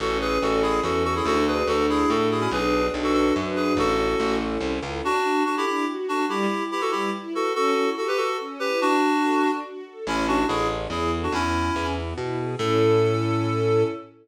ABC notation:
X:1
M:3/4
L:1/16
Q:1/4=143
K:A
V:1 name="Clarinet"
[FA]2 [GB]2 [FA]2 [EG]2 [FA]2 [FA] [EG] | [FA]2 [GB]2 [FA]2 [EG]2 [FA]2 [EG] [CE] | [GB]4 z [FA] [FA]2 z2 [GB]2 | [FA]6 z6 |
[K:D] [DF]4 [DF] [EG] [EG]2 z2 [DF]2 | [EG]4 [EG] [FA] [EG]2 z2 [FA]2 | [FA]4 [FA] [GB] [FA]2 z2 [GB]2 | [DF]8 z4 |
[K:A] [CE]2 [DF]2 [EG]2 z2 [EG]2 z [DF] | [CE]6 z6 | A12 |]
V:2 name="String Ensemble 1"
C2 E2 A2 E2 C2 E2 | D2 F2 A2 F2 D2 F2 | D2 F2 B2 F2 D2 F2 | C2 E2 A2 E2 C2 E2 |
[K:D] D2 F2 A2 D2 F2 A2 | G,2 E2 B2 G,2 E2 B2 | C2 E2 G2 A2 C2 E2 | D2 F2 A2 D2 F2 A2 |
[K:A] C2 E2 A2 C2 E2 A2 | B,2 E2 G2 B,2 E2 G2 | [CEA]12 |]
V:3 name="Electric Bass (finger)" clef=bass
A,,,4 A,,,4 E,,4 | D,,4 D,,4 A,,4 | B,,,4 B,,,4 F,,4 | A,,,4 A,,,4 =C,,2 ^C,,2 |
[K:D] z12 | z12 | z12 | z12 |
[K:A] A,,,4 A,,,4 E,,4 | E,,4 E,,4 B,,4 | A,,12 |]